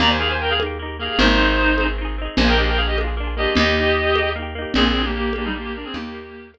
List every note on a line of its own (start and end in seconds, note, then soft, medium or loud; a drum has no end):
0.00 1.09 D#2 loud
0.00 0.18 A#3 loud
0.00 0.18 D#4 loud
0.00 0.09 D5 loud
0.00 0.09 A#5 loud
0.00 low conga medium
0.07 0.18 G4 loud
0.07 0.19 C5 medium
0.07 0.19 G#5 loud
0.19 0.56 A#3 medium
0.19 0.56 D#4 medium
0.19 0.28 G#4 loud
0.19 0.28 F5 loud
0.26 0.56 G4 medium
0.26 0.39 C5 medium
0.26 0.39 G#5 loud
0.40 0.50 A#4 loud
0.40 0.50 G5 loud
0.50 0.59 G#4 loud
0.50 0.59 F5 loud
0.59 0.78 A#3 medium
0.59 0.78 D#4 medium
0.59 high conga medium
0.66 0.78 G4 medium
0.79 0.97 A#3 medium
0.79 0.97 D#4 medium
0.86 0.97 G4 medium
0.99 1.18 A#3 medium
0.99 1.18 D#4 medium
0.99 1.19 G#4 medium
0.99 1.19 F5 loud
1.06 1.18 G4 medium
1.19 2.28 G#1 loud
1.19 1.37 C4 loud
1.19 1.84 D#4 loud
1.19 1.37 D#4 loud
1.19 1.84 C5 loud
1.19 low conga loud
1.26 1.37 G#4 loud
1.39 1.75 C4 medium
1.39 1.75 D#4 medium
1.45 1.75 G#4 loud
1.78 1.96 C4 medium
1.78 1.96 D#4 medium
1.78 high conga medium
1.85 1.96 G#4 medium
1.98 2.16 C4 medium
1.98 2.16 D#4 medium
2.05 2.16 G#4 medium
2.18 2.36 C4 medium
2.18 2.36 D#4 medium
2.25 2.36 G#4 medium
2.37 3.47 A#1 loud
2.37 2.56 A#3 loud
2.37 2.46 C5 loud
2.37 2.46 G#5 loud
2.37 low conga loud
2.41 2.56 D4 loud
2.41 2.56 F4 loud
2.48 2.56 G#4 loud
2.48 2.58 A#4 loud
2.48 2.58 G5 loud
2.57 2.94 A#3 medium
2.57 2.94 D4 loud
2.57 2.67 G4 medium
2.57 2.67 D#5 loud
2.64 2.94 F4 loud
2.64 2.94 G#4 medium
2.64 2.77 A#4 medium
2.64 2.77 G5 loud
2.77 2.86 G#4 medium
2.77 2.86 F5 loud
2.87 2.96 G4 loud
2.87 2.96 D#5 loud
2.97 3.15 A#3 medium
2.97 3.15 D4 medium
2.97 high conga medium
3.04 3.15 F4 medium
3.04 3.15 G#4 medium
3.17 3.35 A#3 medium
3.17 3.35 D4 medium
3.24 3.35 F4 medium
3.24 3.35 G#4 medium
3.37 3.55 A#3 medium
3.37 3.55 D4 medium
3.37 3.54 G4 loud
3.37 3.54 D#5 loud
3.43 3.55 F4 medium
3.43 3.55 G#4 medium
3.55 4.66 D#2 loud
3.55 3.75 A#3 loud
3.55 4.29 G4 loud
3.55 4.29 D#5 loud
3.55 low conga loud
3.60 3.75 D#4 medium
3.60 3.75 G4 loud
3.76 4.13 A#3 medium
3.76 4.13 D#4 loud
3.83 4.13 G4 medium
4.15 4.34 A#3 medium
4.15 4.34 D#4 medium
4.15 high conga medium
4.23 4.34 G4 medium
4.36 4.54 A#3 medium
4.36 4.54 D#4 loud
4.42 4.54 G4 medium
4.55 4.73 A#3 medium
4.55 4.73 D#4 medium
4.62 4.73 G4 medium
4.74 5.85 A#1 loud
4.74 4.93 A#3 medium
4.74 5.02 C4 loud
4.74 5.02 G#4 loud
4.74 low conga loud
4.78 4.93 D4 loud
4.78 4.93 F4 loud
4.85 4.93 G#4 medium
4.95 5.32 A#3 medium
4.95 5.32 D4 medium
5.02 5.14 A#3 loud
5.02 5.32 F4 medium
5.02 5.14 G4 loud
5.02 5.32 G#4 medium
5.15 5.33 A#3 loud
5.15 5.33 G4 loud
5.33 5.53 A#3 medium
5.33 5.45 A#3 loud
5.33 5.45 G4 loud
5.33 high conga medium
5.38 5.53 D4 loud
5.38 5.53 F4 medium
5.45 5.54 G3 loud
5.45 5.54 D#4 loud
5.45 5.53 G#4 medium
5.54 5.73 A#3 medium
5.54 5.64 A#3 loud
5.54 5.73 D4 medium
5.54 5.64 G4 loud
5.61 5.74 A#3 loud
5.61 5.73 F4 medium
5.61 5.74 G4 loud
5.61 5.73 G#4 loud
5.74 5.92 A#3 medium
5.74 5.85 D4 medium
5.74 5.92 D4 medium
5.74 5.85 A#4 loud
5.81 5.94 C4 loud
5.81 5.92 F4 medium
5.81 5.94 G#4 loud
5.81 5.92 G#4 medium
5.94 6.58 D#2 loud
5.94 6.48 A#3 loud
5.94 6.12 A#3 loud
5.94 6.12 D#4 loud
5.94 6.48 G4 loud
5.94 low conga loud
6.01 6.12 G4 loud
6.14 6.50 A#3 loud
6.14 6.50 D#4 medium
6.21 6.50 G4 medium
6.54 6.58 A#3 medium
6.54 6.58 D#4 medium
6.54 high conga medium